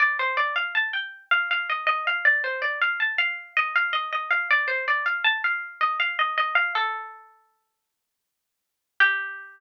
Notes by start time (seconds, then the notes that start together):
0.00 D5
0.19 C5
0.37 D5
0.56 F5
0.75 A5
0.93 G5
1.31 F5
1.51 F5
1.70 D#5
1.87 D#5
2.07 F5
2.25 D5
2.44 C5
2.62 D5
2.81 F5
3.00 A5
3.18 F5
3.57 D#5
3.76 F5
3.93 D#5
4.12 D#5
4.31 F5
4.51 D5
4.68 C5
4.88 D5
5.06 F5
5.24 A5
5.44 F5
5.81 D#5
6.00 F5
6.19 D#5
6.38 D#5
6.55 F5
6.75 A4
9.00 G4